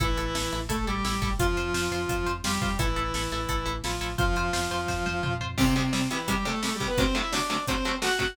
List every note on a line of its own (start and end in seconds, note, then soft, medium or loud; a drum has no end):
0.00 0.15 A1 loud
0.00 0.58 E3 loud
0.00 0.07 E4 medium
0.00 0.58 E4 loud
0.00 0.07 A4 medium
0.00 kick medium
0.00 closed hi-hat medium
0.17 0.32 A1 medium
0.17 0.24 E4 medium
0.17 0.24 A4 medium
0.17 closed hi-hat medium
0.35 0.50 A1 medium
0.35 0.42 E4 medium
0.35 0.42 A4 medium
0.35 snare loud
0.52 0.68 A1 medium
0.52 0.60 E4 medium
0.52 0.60 A4 medium
0.52 closed hi-hat medium
0.69 0.84 A1 medium
0.69 0.85 A3 medium
0.69 0.76 E4 medium
0.69 0.76 A4 medium
0.69 0.85 A4 medium
0.69 kick medium
0.69 closed hi-hat loud
0.87 1.02 A1 medium
0.87 1.31 G3 medium
0.87 0.94 E4 medium
0.87 1.31 G4 medium
0.87 0.94 A4 medium
0.87 closed hi-hat medium
1.05 1.20 A1 medium
1.05 1.12 E4 medium
1.05 1.12 A4 medium
1.05 snare medium
1.22 1.37 A1 medium
1.22 1.29 E4 medium
1.22 1.29 A4 medium
1.22 kick medium
1.22 closed hi-hat medium
1.39 1.54 F2 medium
1.39 2.32 F3 loud
1.39 2.32 F4 loud
1.39 1.47 F4 medium
1.39 1.47 C5 medium
1.39 kick medium
1.39 closed hi-hat loud
1.57 1.72 F2 medium
1.57 1.64 F4 medium
1.57 1.64 C5 medium
1.57 closed hi-hat medium
1.74 1.89 F2 medium
1.74 1.81 F4 medium
1.74 1.81 C5 medium
1.74 snare loud
1.91 2.06 F2 medium
1.91 1.99 F4 medium
1.91 1.99 C5 medium
1.91 closed hi-hat medium
2.09 2.24 F2 medium
2.09 2.16 F4 medium
2.09 2.16 C5 medium
2.09 kick medium
2.09 closed hi-hat medium
2.26 2.42 F2 medium
2.26 2.33 F4 medium
2.26 2.33 C5 medium
2.26 closed hi-hat medium
2.44 2.59 F2 medium
2.44 2.75 G3 medium
2.44 2.52 F4 medium
2.44 2.75 G4 loud
2.44 2.52 C5 medium
2.44 snare loud
2.62 2.76 F2 medium
2.62 2.69 F4 medium
2.62 2.69 C5 medium
2.62 kick medium
2.62 closed hi-hat medium
2.79 2.94 A1 medium
2.79 3.74 E3 medium
2.79 3.74 E4 loud
2.79 2.86 E4 medium
2.79 2.86 A4 medium
2.79 kick medium
2.79 closed hi-hat loud
2.96 3.12 A1 medium
2.96 3.03 E4 medium
2.96 3.03 A4 medium
2.96 closed hi-hat medium
3.14 3.29 A1 medium
3.14 3.22 E4 medium
3.14 3.22 A4 medium
3.14 snare medium
3.31 3.47 A1 medium
3.31 3.39 E4 medium
3.31 3.39 A4 medium
3.31 closed hi-hat medium
3.49 3.64 A1 medium
3.49 3.56 E4 medium
3.49 3.56 A4 medium
3.49 kick medium
3.49 closed hi-hat medium
3.66 3.81 A1 medium
3.66 3.73 E4 medium
3.66 3.73 A4 medium
3.66 closed hi-hat medium
3.84 3.99 A1 medium
3.84 4.13 F3 medium
3.84 3.91 E4 medium
3.84 4.13 F4 medium
3.84 3.91 A4 medium
3.84 snare medium
4.01 4.16 A1 medium
4.01 4.08 E4 medium
4.01 4.08 A4 medium
4.01 closed hi-hat medium
4.18 4.34 F2 medium
4.18 5.34 F3 loud
4.18 5.34 F4 loud
4.18 4.25 F4 medium
4.18 4.25 C5 medium
4.18 kick loud
4.18 closed hi-hat medium
4.35 4.50 F2 medium
4.35 4.44 F4 medium
4.35 4.44 C5 medium
4.35 closed hi-hat medium
4.53 4.68 F2 medium
4.53 4.60 F4 medium
4.53 4.60 C5 medium
4.53 snare loud
4.71 4.86 F2 medium
4.71 4.78 F4 medium
4.71 4.78 C5 medium
4.71 closed hi-hat medium
4.88 5.03 F2 medium
4.88 4.95 F4 medium
4.88 4.95 C5 medium
4.88 kick medium
4.88 snare medium
5.06 5.21 F2 medium
5.06 5.13 F4 medium
5.06 5.13 C5 medium
5.06 high tom medium
5.23 5.39 F2 medium
5.23 5.30 F4 medium
5.23 5.30 C5 medium
5.23 mid tom medium
5.41 5.56 F2 medium
5.41 5.48 F4 medium
5.41 5.48 C5 medium
5.41 floor tom medium
5.58 5.65 C2 medium
5.58 5.65 C3 medium
5.58 5.74 C3 loud
5.58 5.65 G3 medium
5.58 5.74 C4 loud
5.58 kick medium
5.58 crash loud
5.76 5.83 C2 medium
5.76 5.83 C3 medium
5.76 6.08 C3 medium
5.76 5.83 G3 medium
5.76 6.08 C4 medium
5.76 closed hi-hat medium
5.93 6.00 C2 medium
5.93 6.00 C3 medium
5.93 6.00 G3 medium
5.93 snare medium
6.11 6.18 C2 medium
6.11 6.18 C3 medium
6.11 6.28 E3 medium
6.11 6.18 G3 medium
6.11 6.28 E4 medium
6.11 closed hi-hat medium
6.28 6.35 C2 medium
6.28 6.35 C3 medium
6.28 6.44 G3 medium
6.28 6.35 G3 medium
6.28 6.44 G4 medium
6.28 kick medium
6.28 closed hi-hat loud
6.45 6.52 C2 medium
6.45 6.52 C3 medium
6.45 6.52 G3 medium
6.45 6.61 A3 medium
6.45 6.61 A4 loud
6.45 closed hi-hat medium
6.63 6.70 C2 medium
6.63 6.70 C3 medium
6.63 6.70 G3 medium
6.63 6.74 A3 medium
6.63 6.74 A4 medium
6.63 snare loud
6.75 6.86 G3 medium
6.75 6.86 G4 medium
6.80 6.87 C2 medium
6.80 6.87 C3 medium
6.80 6.87 G3 medium
6.80 kick medium
6.80 closed hi-hat medium
6.87 6.98 B3 medium
6.87 6.98 B4 medium
6.98 7.05 D2 medium
6.98 7.05 C3 medium
6.98 7.05 F#3 medium
6.98 7.05 A3 medium
6.98 7.16 C4 medium
6.98 7.16 C5 loud
6.98 kick loud
6.98 closed hi-hat medium
7.15 7.22 D2 medium
7.15 7.22 C3 medium
7.15 7.22 F#3 medium
7.15 7.22 A3 medium
7.15 7.32 E4 medium
7.15 7.32 E5 medium
7.15 closed hi-hat medium
7.31 7.40 D2 medium
7.31 7.40 C3 medium
7.31 7.40 F#3 medium
7.31 7.40 A3 medium
7.31 7.63 D4 medium
7.31 7.63 D5 medium
7.31 snare loud
7.50 7.57 D2 medium
7.50 7.57 C3 medium
7.50 7.57 F#3 medium
7.50 7.57 A3 medium
7.50 closed hi-hat medium
7.67 7.75 D2 medium
7.67 7.75 C3 medium
7.67 7.75 F#3 medium
7.67 7.75 A3 medium
7.67 7.95 C4 medium
7.67 7.95 C5 medium
7.67 kick medium
7.67 closed hi-hat medium
7.85 7.92 D2 medium
7.85 7.92 C3 medium
7.85 7.92 F#3 medium
7.85 7.92 A3 medium
7.85 closed hi-hat medium
8.02 8.09 D2 medium
8.02 8.09 C3 medium
8.02 8.09 F#3 medium
8.02 8.09 A3 medium
8.02 8.18 F#4 medium
8.02 8.18 F#5 loud
8.02 snare loud
8.19 8.26 D2 medium
8.19 8.26 C3 medium
8.19 8.26 F#3 medium
8.19 8.26 A3 medium
8.19 8.34 F#4 medium
8.19 8.34 F#5 loud
8.19 kick medium
8.19 closed hi-hat medium